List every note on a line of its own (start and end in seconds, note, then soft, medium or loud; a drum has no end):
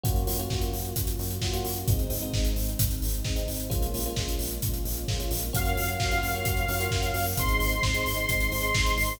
0.04 0.24 F#2 medium
0.04 0.22 A#3 loud
0.04 1.88 A#3 medium
0.04 0.22 C#4 medium
0.04 1.88 C#4 medium
0.04 0.22 F4 medium
0.04 1.88 F4 medium
0.04 0.22 F#4 medium
0.04 1.88 F#4 medium
0.04 kick loud
0.04 closed hi-hat loud
0.16 closed hi-hat medium
0.27 0.47 F#2 medium
0.27 0.36 A#3 medium
0.27 0.36 C#4 medium
0.27 0.36 F4 medium
0.27 0.36 F#4 medium
0.27 open hi-hat loud
0.39 0.48 A#3 medium
0.39 0.48 C#4 medium
0.39 0.48 F4 medium
0.39 0.48 F#4 medium
0.39 closed hi-hat medium
0.50 0.70 F#2 medium
0.50 0.87 A#3 medium
0.50 0.87 C#4 medium
0.50 0.87 F4 medium
0.50 0.87 F#4 medium
0.50 kick loud
0.50 snare loud
0.61 closed hi-hat medium
0.73 0.93 F#2 medium
0.73 open hi-hat medium
0.85 closed hi-hat medium
0.96 1.15 F#2 medium
0.96 kick loud
0.96 closed hi-hat loud
1.07 closed hi-hat loud
1.19 1.39 F#2 medium
1.19 open hi-hat medium
1.30 closed hi-hat medium
1.41 1.61 F#2 medium
1.41 1.51 A#3 medium
1.41 1.51 C#4 medium
1.41 1.51 F4 medium
1.41 1.51 F#4 medium
1.41 kick medium
1.41 snare loud
1.53 1.81 A#3 medium
1.53 1.81 C#4 medium
1.53 1.81 F4 medium
1.53 1.81 F#4 medium
1.53 closed hi-hat medium
1.65 1.84 F#2 medium
1.65 open hi-hat loud
1.76 closed hi-hat medium
1.88 2.07 G#1 medium
1.88 3.69 G#3 medium
1.88 2.07 G#3 medium
1.88 3.69 C4 medium
1.88 2.07 C4 medium
1.88 3.69 D#4 medium
1.88 2.07 D#4 medium
1.88 kick loud
1.88 closed hi-hat loud
1.99 closed hi-hat medium
2.10 2.30 G#1 medium
2.10 2.19 G#3 medium
2.10 2.19 C4 medium
2.10 2.19 D#4 medium
2.10 open hi-hat loud
2.22 2.31 G#3 medium
2.22 2.31 C4 medium
2.22 2.31 D#4 medium
2.22 closed hi-hat medium
2.33 2.53 G#1 medium
2.33 2.71 G#3 medium
2.33 2.71 C4 medium
2.33 2.71 D#4 medium
2.33 kick loud
2.33 snare loud
2.45 closed hi-hat medium
2.56 2.76 G#1 medium
2.56 open hi-hat medium
2.68 closed hi-hat medium
2.79 2.99 G#1 medium
2.79 kick loud
2.79 closed hi-hat loud
2.91 closed hi-hat medium
3.02 3.21 G#1 medium
3.02 open hi-hat medium
3.14 closed hi-hat medium
3.25 3.45 G#1 medium
3.25 3.34 G#3 medium
3.25 3.34 C4 medium
3.25 3.34 D#4 medium
3.25 kick loud
3.25 snare loud
3.36 3.63 G#3 medium
3.36 3.63 C4 medium
3.36 3.63 D#4 medium
3.36 closed hi-hat medium
3.48 3.67 G#1 medium
3.48 open hi-hat medium
3.60 closed hi-hat medium
3.70 3.90 A#1 medium
3.70 5.51 G#3 medium
3.70 3.88 G#3 loud
3.70 5.51 A#3 medium
3.70 3.88 A#3 medium
3.70 5.51 C#4 medium
3.70 3.88 C#4 medium
3.70 5.51 F4 medium
3.70 3.88 F4 loud
3.70 kick loud
3.70 closed hi-hat loud
3.82 closed hi-hat medium
3.94 4.13 A#1 medium
3.94 4.04 G#3 medium
3.94 4.04 A#3 medium
3.94 4.04 C#4 medium
3.94 4.04 F4 medium
3.94 open hi-hat loud
4.06 4.15 G#3 medium
4.06 4.15 A#3 medium
4.06 4.15 C#4 medium
4.06 4.15 F4 medium
4.06 closed hi-hat medium
4.16 4.36 A#1 medium
4.16 4.55 G#3 medium
4.16 4.55 A#3 medium
4.16 4.55 C#4 medium
4.16 4.55 F4 medium
4.16 kick loud
4.16 snare loud
4.28 closed hi-hat medium
4.39 4.59 A#1 medium
4.39 open hi-hat loud
4.51 closed hi-hat medium
4.62 4.82 A#1 medium
4.62 kick loud
4.62 closed hi-hat loud
4.74 closed hi-hat medium
4.85 5.05 A#1 medium
4.85 open hi-hat medium
4.97 closed hi-hat medium
5.08 5.28 A#1 medium
5.08 5.17 G#3 medium
5.08 5.17 A#3 medium
5.08 5.17 C#4 medium
5.08 5.17 F4 medium
5.08 kick loud
5.08 snare loud
5.19 5.47 G#3 medium
5.19 5.47 A#3 medium
5.19 5.47 C#4 medium
5.19 5.47 F4 medium
5.19 closed hi-hat medium
5.31 5.51 A#1 medium
5.31 open hi-hat loud
5.42 closed hi-hat medium
5.53 5.73 F#2 medium
5.53 5.90 A#3 medium
5.53 5.90 C#4 loud
5.53 5.90 F4 medium
5.53 5.90 F#4 medium
5.53 7.36 A#4 medium
5.53 7.36 C#5 medium
5.53 7.25 F5 medium
5.53 7.36 F5 medium
5.53 7.36 F#5 medium
5.53 kick loud
5.53 closed hi-hat loud
5.65 closed hi-hat medium
5.77 5.96 F#2 medium
5.77 open hi-hat loud
5.88 closed hi-hat medium
6.00 6.19 F#2 medium
6.00 6.10 A#3 medium
6.00 6.10 C#4 medium
6.00 6.10 F4 medium
6.00 6.10 F#4 medium
6.00 kick loud
6.00 snare loud
6.11 6.30 A#3 medium
6.11 6.30 C#4 medium
6.11 6.30 F4 loud
6.11 6.30 F#4 medium
6.11 closed hi-hat medium
6.23 6.42 F#2 medium
6.23 open hi-hat medium
6.35 6.44 A#3 medium
6.35 6.44 C#4 medium
6.35 6.44 F4 medium
6.35 6.44 F#4 medium
6.35 closed hi-hat medium
6.45 6.65 F#2 medium
6.45 6.64 A#3 medium
6.45 6.64 C#4 medium
6.45 6.64 F4 medium
6.45 6.64 F#4 medium
6.45 kick loud
6.45 closed hi-hat loud
6.57 closed hi-hat medium
6.68 6.88 F#2 medium
6.68 6.78 A#3 medium
6.68 6.78 C#4 medium
6.68 6.78 F4 loud
6.68 6.78 F#4 medium
6.68 open hi-hat loud
6.80 6.89 A#3 medium
6.80 6.89 C#4 medium
6.80 6.89 F4 medium
6.80 6.89 F#4 medium
6.80 closed hi-hat loud
6.91 7.11 F#2 medium
6.91 7.28 A#3 medium
6.91 7.28 C#4 medium
6.91 7.28 F4 medium
6.91 7.28 F#4 medium
6.91 kick loud
6.91 snare loud
7.03 closed hi-hat medium
7.14 7.34 F#2 medium
7.14 open hi-hat medium
7.26 open hi-hat medium
7.37 7.57 G#1 medium
7.37 7.75 G#3 loud
7.37 7.75 C4 loud
7.37 7.75 D#4 medium
7.37 9.20 G#4 medium
7.37 9.20 C5 medium
7.37 9.20 D#5 medium
7.37 9.13 C6 medium
7.37 kick loud
7.37 closed hi-hat loud
7.48 closed hi-hat medium
7.60 7.80 G#1 medium
7.60 open hi-hat medium
7.72 closed hi-hat medium
7.83 8.03 G#1 medium
7.83 7.92 G#3 medium
7.83 7.92 C4 medium
7.83 7.92 D#4 medium
7.83 kick loud
7.83 snare loud
7.94 8.13 G#3 medium
7.94 8.13 C4 medium
7.94 8.13 D#4 medium
7.94 closed hi-hat medium
8.06 8.26 G#1 medium
8.06 open hi-hat loud
8.17 8.26 G#3 medium
8.17 8.26 C4 medium
8.17 8.26 D#4 medium
8.17 closed hi-hat medium
8.29 8.48 G#1 medium
8.29 8.48 G#3 medium
8.29 8.48 C4 medium
8.29 8.48 D#4 medium
8.29 kick loud
8.29 closed hi-hat loud
8.40 closed hi-hat medium
8.52 8.71 G#1 medium
8.52 8.61 G#3 medium
8.52 8.61 C4 medium
8.52 8.61 D#4 medium
8.52 open hi-hat loud
8.62 8.71 G#3 medium
8.62 8.71 C4 medium
8.62 8.71 D#4 medium
8.62 closed hi-hat medium
8.74 8.94 G#1 medium
8.74 9.12 G#3 medium
8.74 9.12 C4 medium
8.74 9.12 D#4 medium
8.74 kick loud
8.74 snare loud
8.86 closed hi-hat medium
8.98 9.17 G#1 medium
8.98 open hi-hat loud
9.09 open hi-hat medium